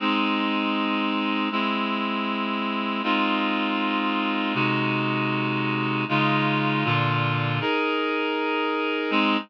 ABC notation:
X:1
M:4/4
L:1/8
Q:1/4=79
K:Ab
V:1 name="Clarinet"
[A,CE]4 [A,C=E]4 | [A,CEF]4 [C,A,E_G]4 | [D,A,EF]2 [B,,=D,F]2 [EAB]4 | [A,CE]2 z6 |]